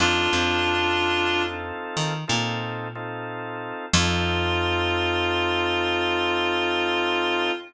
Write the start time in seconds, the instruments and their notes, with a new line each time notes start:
0.00 electric bass (finger) F2, drawbar organ C4 D#4 F4 A4, clarinet D4 F4
0.33 electric bass (finger) F2, drawbar organ C4 D#4 F4 A4
1.97 electric bass (finger) D#3
2.28 electric bass (finger) A#2, drawbar organ C4 D#4 F4 A4
2.95 drawbar organ C4 D#4 F4 A4
3.93 electric bass (finger) F2, drawbar organ C4 D#4 F4 A4, clarinet F4